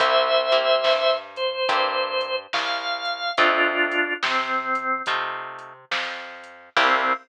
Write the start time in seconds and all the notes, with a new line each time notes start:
0.00 C2 A#3 C4 E4 G4 C5 E5, kick, closed hi-hat
0.52 A#3 C4 E4 G4, closed hi-hat
0.84 G2, snare
1.36 C5, closed hi-hat
1.69 G2 A#3 C4 E4 G4, kick, closed hi-hat
2.21 closed hi-hat
2.53 C2 F5, snare
3.05 closed hi-hat
3.37 F2 A3 C4 D4 D#4 F4, kick, closed hi-hat
3.91 closed hi-hat
4.23 C3 C4, snare
4.75 closed hi-hat
5.06 C3 A3 C4 D#4 F4, kick, closed hi-hat
5.59 closed hi-hat
5.91 F2, snare
6.43 closed hi-hat
6.77 C2 A#3 C4 E4 G4, kick, crash